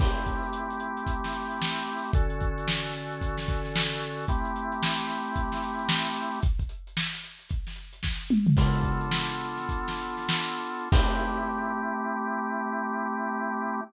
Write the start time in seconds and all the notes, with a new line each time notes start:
0.00 A3 C4 E4 G4, kick, crash
0.16 closed hi-hat
0.26 kick, closed hi-hat
0.43 closed hi-hat
0.53 closed hi-hat
0.70 closed hi-hat
0.80 closed hi-hat
0.97 closed hi-hat
1.07 kick, closed hi-hat
1.24 snare, closed hi-hat
1.34 closed hi-hat
1.51 closed hi-hat
1.62 snare
1.77 closed hi-hat
1.87 closed hi-hat
2.05 closed hi-hat
2.13 D3 C#4 F#4 A4, kick, closed hi-hat
2.30 closed hi-hat
2.41 kick, closed hi-hat
2.58 closed hi-hat
2.68 snare
2.85 closed hi-hat
2.94 closed hi-hat
3.11 closed hi-hat
3.21 kick, closed hi-hat
3.38 snare, closed hi-hat
3.48 kick, closed hi-hat
3.65 snare, closed hi-hat
3.76 snare
3.92 snare, closed hi-hat
4.01 closed hi-hat
4.19 closed hi-hat
4.28 A3 C4 E4 G4, kick, closed hi-hat
4.45 closed hi-hat
4.56 closed hi-hat
4.72 closed hi-hat
4.83 snare
4.98 snare, closed hi-hat
5.08 snare, closed hi-hat
5.25 closed hi-hat
5.36 kick, closed hi-hat
5.52 snare, closed hi-hat
5.63 closed hi-hat
5.79 closed hi-hat
5.89 snare
6.06 closed hi-hat
6.16 closed hi-hat
6.33 closed hi-hat
6.43 kick, closed hi-hat
6.59 kick, closed hi-hat
6.69 closed hi-hat
6.87 closed hi-hat
6.97 snare
7.13 closed hi-hat
7.24 closed hi-hat
7.39 closed hi-hat
7.49 kick, closed hi-hat
7.67 snare, closed hi-hat
7.76 closed hi-hat
7.93 closed hi-hat
8.03 kick, snare
8.30 mid tom
8.47 floor tom
8.57 B3 D4 F4 A4, kick, crash
8.74 closed hi-hat
8.83 kick, closed hi-hat
9.01 closed hi-hat
9.11 snare
9.29 closed hi-hat
9.40 closed hi-hat
9.57 snare, closed hi-hat
9.69 kick, closed hi-hat
9.87 snare, closed hi-hat
9.98 closed hi-hat
10.17 snare, closed hi-hat
10.29 snare
10.48 closed hi-hat
10.61 closed hi-hat
10.79 closed hi-hat
10.92 A3 C4 E4 G4, kick, crash